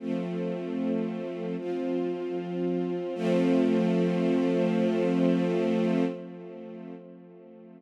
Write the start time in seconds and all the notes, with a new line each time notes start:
0.00 F3 A3 C4
1.58 F3 C4 F4
3.15 F3 A3 C4